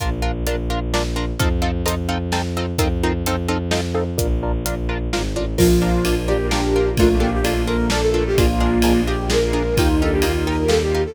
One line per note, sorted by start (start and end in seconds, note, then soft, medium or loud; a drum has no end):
0.00 0.43 A#1 medium
0.00 0.10 D4 medium
0.00 0.10 F4 medium
0.00 0.10 A#4 medium
0.00 kick medium
0.00 closed hi-hat medium
0.22 0.31 D4 medium
0.22 0.31 F4 medium
0.22 0.31 A#4 medium
0.46 1.31 A#1 medium
0.46 0.56 D4 medium
0.46 0.56 F4 medium
0.46 0.56 A#4 medium
0.46 closed hi-hat medium
0.70 0.79 D4 medium
0.70 0.79 F4 medium
0.70 0.79 A#4 medium
0.94 1.03 D4 medium
0.94 1.03 F4 medium
0.94 1.03 A#4 medium
0.94 snare medium
1.16 1.25 D4 medium
1.16 1.25 F4 medium
1.16 1.25 A#4 medium
1.39 1.82 F2 loud
1.39 1.49 C4 medium
1.39 1.49 D#4 medium
1.39 1.49 F4 loud
1.39 1.49 A4 medium
1.39 kick medium
1.39 closed hi-hat medium
1.62 1.71 C4 medium
1.62 1.71 D#4 medium
1.62 1.71 F4 medium
1.62 1.71 A4 medium
1.86 2.72 F2 medium
1.86 1.95 C4 medium
1.86 1.95 D#4 loud
1.86 1.95 F4 medium
1.86 1.95 A4 medium
1.86 closed hi-hat medium
2.09 2.18 C4 medium
2.09 2.18 D#4 medium
2.09 2.18 F4 medium
2.09 2.18 A4 medium
2.32 2.42 C4 medium
2.32 2.42 D#4 medium
2.32 2.42 F4 medium
2.32 2.42 A4 medium
2.32 snare medium
2.57 2.66 C4 medium
2.57 2.66 D#4 medium
2.57 2.66 F4 medium
2.57 2.66 A4 medium
2.78 3.22 F2 medium
2.78 2.88 C4 medium
2.78 2.88 D#4 medium
2.78 2.88 F4 medium
2.78 2.88 A#4 medium
2.78 kick medium
2.78 closed hi-hat medium
3.03 3.13 C4 medium
3.03 3.13 D#4 medium
3.03 3.13 F4 medium
3.03 3.13 A#4 medium
3.25 4.10 F2 medium
3.25 3.36 C4 medium
3.25 3.36 D#4 loud
3.25 3.36 F4 medium
3.25 3.36 A4 medium
3.25 closed hi-hat medium
3.48 3.58 C4 medium
3.48 3.58 D#4 medium
3.48 3.58 F4 medium
3.48 3.58 A4 medium
3.71 3.81 C4 medium
3.71 3.81 D#4 medium
3.71 3.81 F4 medium
3.71 3.81 A4 medium
3.71 snare medium
3.94 4.04 C4 medium
3.94 4.04 D#4 medium
3.94 4.04 F4 medium
3.94 4.04 A4 medium
4.18 4.62 A#1 medium
4.18 4.27 D4 loud
4.18 4.27 F4 loud
4.18 4.27 A#4 loud
4.18 kick medium
4.18 closed hi-hat medium
4.43 4.52 D4 medium
4.43 4.52 F4 medium
4.43 4.52 A#4 medium
4.63 5.08 A#1 medium
4.63 4.75 D4 medium
4.63 4.75 F4 medium
4.63 4.75 A#4 medium
4.63 closed hi-hat medium
4.89 4.98 D4 medium
4.89 4.98 F4 medium
4.89 4.98 A#4 medium
5.12 5.33 G#1 medium
5.12 5.22 D4 medium
5.12 5.22 F4 medium
5.12 5.22 A#4 medium
5.12 snare medium
5.33 5.54 A1 medium
5.33 5.45 D4 medium
5.33 5.45 F4 medium
5.33 5.45 A#4 medium
5.57 6.00 A#1 loud
5.57 6.33 F3 loud
5.57 6.28 A#3 medium
5.57 5.67 D4 medium
5.57 6.28 D4 medium
5.57 6.15 F4 medium
5.57 5.67 F4 medium
5.57 6.28 F4 medium
5.57 5.67 A#4 medium
5.57 kick medium
5.57 crash medium
5.82 5.91 D4 medium
5.82 5.91 F4 medium
5.82 5.91 A#4 medium
6.04 6.90 A#1 medium
6.04 6.14 D4 medium
6.04 6.14 F4 medium
6.04 6.14 A#4 medium
6.04 ride medium
6.27 6.96 A#3 medium
6.27 6.37 D4 medium
6.27 6.37 F4 medium
6.27 6.96 F4 medium
6.27 6.47 G4 medium
6.27 6.37 A#4 medium
6.27 6.98 A#4 medium
6.51 6.61 D4 medium
6.51 6.90 D4 medium
6.51 6.61 F4 medium
6.51 6.89 G4 medium
6.51 6.61 A#4 medium
6.51 snare medium
6.76 6.85 D4 medium
6.76 6.85 F4 medium
6.76 6.85 A#4 medium
6.96 7.40 A#1 loud
6.96 7.66 A3 medium
6.96 7.19 A3 loud
6.96 7.66 A#3 medium
6.96 7.66 D4 medium
6.96 7.09 D4 medium
6.96 7.66 F4 medium
6.96 7.19 F4 medium
6.96 7.09 F4 medium
6.96 7.09 A4 medium
6.96 7.09 A#4 medium
6.96 kick medium
6.96 ride medium
7.19 7.40 A#3 loud
7.19 7.29 D4 medium
7.19 7.29 F4 medium
7.19 7.30 G4 medium
7.19 7.29 A4 medium
7.19 7.29 A#4 medium
7.34 7.45 G4 medium
7.43 8.29 A#1 medium
7.43 7.89 A#3 loud
7.43 7.54 D4 medium
7.43 7.63 F4 medium
7.43 7.54 F4 medium
7.43 7.54 A4 medium
7.43 7.54 A#4 medium
7.43 ride medium
7.67 8.36 A3 medium
7.67 8.36 A#3 medium
7.67 7.77 D4 medium
7.67 8.36 F4 medium
7.67 7.77 F4 medium
7.67 8.36 A4 medium
7.67 7.77 A4 medium
7.67 7.86 A#4 medium
7.67 7.77 A#4 medium
7.89 8.01 D4 medium
7.89 8.01 F4 medium
7.89 8.00 A4 medium
7.89 8.01 A4 medium
7.89 8.01 A#4 medium
7.89 snare loud
8.01 8.24 A4 medium
8.14 8.23 D4 medium
8.14 8.23 F4 medium
8.14 8.23 A4 medium
8.14 8.23 A#4 medium
8.27 8.38 G4 medium
8.35 8.78 A#1 loud
8.35 9.06 G#3 medium
8.35 9.02 A#3 loud
8.35 9.06 A#3 medium
8.35 9.06 D4 medium
8.35 8.47 D4 medium
8.35 9.06 F4 medium
8.35 9.00 F4 loud
8.35 8.47 F4 medium
8.35 8.47 G#4 medium
8.35 8.47 A#4 medium
8.35 kick medium
8.35 ride medium
8.60 8.70 D4 medium
8.60 8.70 F4 medium
8.60 8.70 G#4 medium
8.60 8.70 A#4 medium
8.82 9.69 A#1 medium
8.82 8.93 D4 medium
8.82 8.93 F4 medium
8.82 8.93 G#4 medium
8.82 8.93 A#4 medium
8.82 ride medium
9.07 9.77 G#3 medium
9.07 9.76 A#3 medium
9.07 9.17 D4 medium
9.07 9.17 F4 medium
9.07 9.76 F4 medium
9.07 9.29 G4 medium
9.07 9.17 G#4 medium
9.07 9.77 G#4 medium
9.07 9.17 A#4 medium
9.30 9.40 D4 medium
9.30 9.40 F4 medium
9.30 9.40 G#4 medium
9.30 9.40 A#4 medium
9.30 9.75 A#4 medium
9.30 snare medium
9.53 9.62 D4 medium
9.53 9.62 F4 medium
9.53 9.62 G#4 medium
9.53 9.62 A#4 medium
9.76 10.19 D#2 loud
9.76 10.46 G3 medium
9.76 10.46 A#3 medium
9.76 10.46 D#4 medium
9.76 10.00 D#4 loud
9.76 9.88 D#4 medium
9.76 9.96 F4 medium
9.76 10.46 F4 medium
9.76 9.88 F4 medium
9.76 9.88 G4 medium
9.76 9.88 A#4 medium
9.76 kick medium
9.76 ride medium
10.00 10.22 D4 loud
10.00 10.11 D#4 medium
10.00 10.11 F4 medium
10.00 10.11 G4 medium
10.00 10.13 A4 medium
10.00 10.11 A#4 medium
10.12 10.23 G4 medium
10.22 11.07 D#2 medium
10.22 10.32 D#4 medium
10.22 10.64 D#4 loud
10.22 10.32 F4 medium
10.22 10.46 F4 medium
10.22 10.32 G4 medium
10.22 10.32 A#4 medium
10.22 ride medium
10.46 11.15 G3 medium
10.46 11.15 A#3 medium
10.46 10.56 D#4 medium
10.46 11.15 F4 medium
10.46 10.56 F4 medium
10.46 11.15 G4 medium
10.46 10.56 G4 medium
10.46 10.56 A#4 medium
10.46 10.71 A#4 medium
10.68 10.78 D#4 medium
10.68 10.78 F4 medium
10.68 10.78 G4 medium
10.68 10.80 A4 medium
10.68 10.78 A#4 medium
10.68 snare medium
10.80 11.02 G4 medium
10.95 11.04 D#4 medium
10.95 11.04 F4 medium
10.95 11.04 G4 medium
10.95 11.04 A#4 medium
11.06 11.15 A4 medium